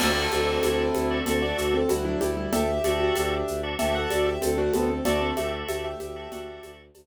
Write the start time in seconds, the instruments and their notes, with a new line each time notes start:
0.00 violin D2, acoustic grand piano A3 C4 A4, drawbar organ F#4 A4 D5 E5, crash, cowbell, low conga, shaker
0.32 violin D2, drawbar organ F#4 A4 D5 E5, high conga, shaker
0.46 acoustic grand piano C4
0.63 violin D2, acoustic grand piano E4, cowbell, high conga, shaker
0.94 violin D2, high conga, shaker
1.10 drawbar organ F#4 A4 D5 E5
1.26 violin D2, acoustic grand piano C4 A4, drawbar organ F#4 A4 D5 E5, cowbell, low conga, shaker
1.42 acoustic grand piano F#4 D5
1.58 violin D2, acoustic grand piano A3 F#4, shaker
1.74 acoustic grand piano C4 A4
1.89 violin D2, acoustic grand piano G3 E4 F#4, cowbell, high conga, shaker
2.05 acoustic grand piano F#3 D4 E4
2.20 violin D2, acoustic grand piano G3 E4 G4, high conga, shaker
2.37 acoustic grand piano G3 E4
2.52 violin D2, acoustic grand piano G4 A4 E5, cowbell, low conga, shaker
2.84 violin D2, drawbar organ F#4 A4 D5 E5, high conga, shaker
3.00 acoustic grand piano F#4
3.16 violin D2, acoustic grand piano D4, cowbell, high conga, shaker
3.48 violin D2, shaker
3.63 drawbar organ F#4 A4 D5 E5
3.79 violin D2, drawbar organ F#4 A4 D5 E5, acoustic grand piano G4 E5, cowbell, low conga, shaker
3.95 acoustic grand piano A4 F#5
4.10 violin D2, acoustic grand piano F#4 D5, high conga, shaker
4.26 acoustic grand piano G4 E5
4.41 violin D2, acoustic grand piano C4 A4, cowbell, high conga, shaker
4.58 acoustic grand piano A3 D4 F#4
4.73 violin D2, acoustic grand piano B3 C4 A4, high conga, shaker
4.89 acoustic grand piano C4 A4
5.05 violin D2, acoustic grand piano A3 F#4 D5, drawbar organ F#4 A4 D5 E5, cowbell, low conga, shaker
5.21 acoustic grand piano C4 A4
5.37 violin D2, drawbar organ F#4 A4 D5 E5, acoustic grand piano G4 E5, high conga, shaker
5.68 violin D2, acoustic grand piano G4 E5, cowbell, high conga, shaker
5.84 acoustic grand piano G4 E5
6.00 violin D2, acoustic grand piano G4 E5, high conga, shaker
6.16 drawbar organ F#4 A4 D5 E5
6.31 violin D2, acoustic grand piano F#4, drawbar organ F#4 A4 D5 E5, cowbell, low conga, shaker
6.63 violin D2, high conga, shaker
6.94 violin D2, cowbell, high conga, shaker